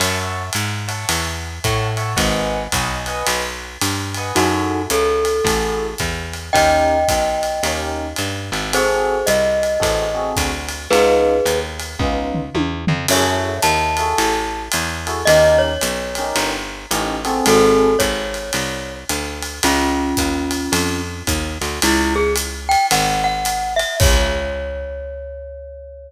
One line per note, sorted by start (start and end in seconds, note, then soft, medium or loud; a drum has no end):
0.00 0.50 F#2 medium
0.00 0.43 C#5 medium
0.00 0.43 E5 loud
0.00 0.43 F#5 medium
0.00 0.43 A5 medium
0.00 ride medium
0.53 1.05 G#2 medium
0.53 hi-hat pedal medium
0.53 ride medium
0.88 1.22 C#5 medium
0.88 1.22 E5 medium
0.88 1.22 F#5 medium
0.88 1.22 A5 medium
0.88 ride medium
1.09 1.59 E2 medium
1.09 ride medium
1.64 2.15 A2 medium
1.64 1.88 C#5 medium
1.64 1.88 E5 medium
1.64 1.88 F#5 medium
1.64 1.88 A5 medium
1.64 kick medium
1.64 hi-hat pedal medium
1.64 ride medium
1.97 2.12 C#5 medium
1.97 2.12 E5 medium
1.97 2.12 F#5 medium
1.97 2.12 A5 medium
1.97 ride medium
2.16 2.68 G#1 medium
2.16 2.59 B4 medium
2.16 2.59 D#5 medium
2.16 2.59 F#5 loud
2.16 2.59 G#5 medium
2.16 kick medium
2.16 ride medium
2.72 3.23 B1 medium
2.72 2.97 B4 medium
2.72 2.97 D#5 medium
2.72 2.97 F#5 medium
2.72 2.97 G#5 medium
2.72 kick soft
2.72 hi-hat pedal medium
2.72 ride medium
3.06 3.41 B4 medium
3.06 3.41 D#5 medium
3.06 3.41 F#5 medium
3.06 3.41 G#5 medium
3.06 ride medium
3.26 3.78 B1 medium
3.26 ride medium
3.81 4.32 G2 medium
3.81 hi-hat pedal medium
3.81 ride medium
4.14 4.32 B4 medium
4.14 4.32 D#5 medium
4.14 4.32 F#5 medium
4.14 4.32 G#5 medium
4.14 ride medium
4.35 4.87 F#2 medium
4.35 4.82 D#4 medium
4.35 4.78 E4 medium
4.35 4.82 F#4 medium
4.35 4.78 F#4 loud
4.35 4.78 G#4 medium
4.35 4.78 A4 medium
4.35 ride medium
4.90 5.41 C#2 medium
4.90 5.85 A4 medium
4.90 hi-hat pedal medium
4.90 ride medium
5.25 ride medium
5.44 5.95 A1 medium
5.44 5.88 E4 medium
5.44 5.88 F#4 medium
5.44 5.88 G#4 medium
5.44 5.88 A4 medium
5.44 kick soft
5.44 ride medium
5.98 6.50 E2 medium
5.98 kick soft
5.98 hi-hat pedal medium
5.98 ride medium
6.33 ride medium
6.53 7.05 D#2 medium
6.53 6.96 C#4 medium
6.53 6.96 D#4 medium
6.53 6.96 G4 medium
6.53 6.96 A#4 medium
6.53 7.81 D#5 medium
6.53 7.81 G5 medium
6.53 kick soft
6.53 ride medium
7.08 7.60 B1 soft
7.08 kick soft
7.08 hi-hat pedal medium
7.08 ride medium
7.43 ride medium
7.63 8.14 D#2 medium
7.63 8.05 C#4 medium
7.63 8.05 D#4 medium
7.63 8.05 G4 medium
7.63 8.05 A#4 medium
7.63 ride medium
8.16 8.51 G2 medium
8.16 hi-hat pedal medium
8.16 ride medium
8.52 9.23 G#1 medium
8.52 ride medium
8.73 9.16 C4 medium
8.73 9.16 F#4 loud
8.73 9.16 G#4 loud
8.73 9.26 G#4 medium
8.73 9.16 A4 medium
8.73 9.26 C5 medium
8.73 ride medium
9.26 9.78 C2 medium
9.26 10.31 D#5 medium
9.26 hi-hat pedal medium
9.26 ride medium
9.63 ride medium
9.80 10.33 A1 medium
9.80 10.04 C4 medium
9.80 10.04 F#4 medium
9.80 10.04 G#4 medium
9.80 10.04 A4 medium
9.80 kick soft
9.80 ride medium
10.15 10.49 C4 medium
10.15 10.49 F#4 medium
10.15 10.49 G#4 medium
10.15 10.49 A4 medium
10.36 10.88 D2 medium
10.36 kick medium
10.36 hi-hat pedal medium
10.36 ride medium
10.69 ride medium
10.90 11.41 C#2 medium
10.90 11.33 B3 medium
10.90 11.33 C#4 medium
10.90 11.33 D#4 loud
10.90 11.33 F4 medium
10.90 11.59 G#4 medium
10.90 11.59 B4 medium
10.90 ride medium
11.45 11.96 D#2 medium
11.45 hi-hat pedal medium
11.45 ride medium
11.80 ride medium
11.99 12.50 C#2 medium
11.99 12.41 B3 medium
11.99 12.41 C#4 medium
11.99 12.41 D#4 medium
11.99 12.41 F4 medium
11.99 kick medium
12.35 floor tom medium
12.55 12.85 E2 medium
12.55 high tom medium
12.87 13.07 F2 medium
12.87 floor tom medium
13.08 13.59 F#2 medium
13.08 13.51 E4 medium
13.08 13.51 F#4 medium
13.08 13.51 G#4 medium
13.08 13.51 A4 loud
13.08 13.57 C#5 medium
13.08 13.57 E5 medium
13.08 crash loud
13.08 ride medium
13.62 14.14 D#2 medium
13.62 14.63 A5 medium
13.62 hi-hat pedal medium
13.62 ride medium
13.97 14.33 E4 medium
13.97 14.33 F#4 medium
13.97 14.33 G#4 medium
13.97 14.33 A4 medium
13.97 ride medium
14.18 14.69 A1 medium
14.18 ride medium
14.72 15.24 E2 medium
14.72 hi-hat pedal medium
14.72 ride medium
15.07 15.21 E4 medium
15.07 15.21 F#4 medium
15.07 15.21 G#4 medium
15.07 15.21 A4 medium
15.07 ride medium
15.25 15.78 D#2 medium
15.25 15.70 C#4 medium
15.25 15.70 D#4 medium
15.25 15.70 G4 loud
15.25 15.70 A#4 loud
15.25 15.59 D#5 medium
15.25 ride medium
15.58 16.46 C#5 medium
15.81 16.33 B1 medium
15.81 hi-hat pedal medium
15.81 ride medium
16.15 16.52 C#4 medium
16.15 16.52 D#4 medium
16.15 16.52 G4 medium
16.15 16.52 A#4 medium
16.15 ride medium
16.35 16.86 G1 medium
16.35 ride medium
16.91 17.41 A1 medium
16.91 17.14 C#4 medium
16.91 17.14 D#4 medium
16.91 17.14 G4 medium
16.91 17.14 A#4 medium
16.91 hi-hat pedal medium
16.91 ride medium
17.25 17.88 C4 loud
17.25 17.88 F#4 medium
17.25 17.88 G#4 loud
17.25 17.88 A4 loud
17.25 ride medium
17.46 17.96 G#1 medium
17.46 17.97 F#4 medium
17.46 17.97 A4 medium
17.46 ride medium
17.99 18.51 G#1 medium
17.99 18.94 C#5 medium
17.99 kick soft
17.99 hi-hat pedal medium
17.99 ride medium
18.34 ride medium
18.53 19.04 C2 medium
18.53 ride medium
19.09 19.60 D2 medium
19.09 hi-hat pedal medium
19.09 ride medium
19.43 ride medium
19.63 20.14 C#2 medium
19.63 21.02 C#4 medium
19.63 21.02 F4 medium
19.63 ride medium
20.17 20.69 D#2 medium
20.17 kick soft
20.17 hi-hat pedal medium
20.17 ride medium
20.51 ride medium
20.72 21.23 F2 medium
20.72 ride medium
21.27 21.58 D#2 medium
21.27 kick medium
21.27 hi-hat pedal medium
21.27 ride medium
21.61 21.80 D2 medium
21.61 ride medium
21.82 22.76 C#2 loud
21.82 22.14 E4 loud
21.82 ride loud
22.16 22.33 G#4 medium
22.36 hi-hat pedal medium
22.36 ride medium
22.69 22.86 G5 medium
22.69 ride medium
22.91 23.84 G#1 medium
22.91 23.24 F#5 medium
22.91 ride loud
23.24 23.74 F#5 medium
23.45 hi-hat pedal medium
23.45 ride medium
23.76 23.95 E5 medium
23.76 ride medium
24.00 26.11 C#2 loud
24.00 26.11 C#5 loud
24.00 kick loud
24.00 crash loud